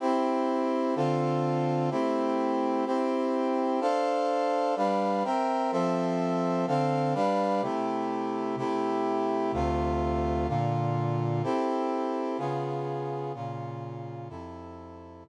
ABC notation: X:1
M:4/4
L:1/8
Q:1/4=126
K:C
V:1 name="Brass Section"
[CEG]4 [D,CFA]4 | [A,CEG]4 [CEG]4 | [DAcf]4 [G,DBf]2 [C_Beg]2 | [F,CAe]4 [D,CAf]2 [G,DBf]2 |
[C,A,EG]4 [C,A,EG]4 | [D,,C,A,F]4 [_B,,D,F]4 | [CEGA]4 [_D,_CF_A]4 | [_B,,_D,F]4 [F,,C,EA]4 |
z8 |]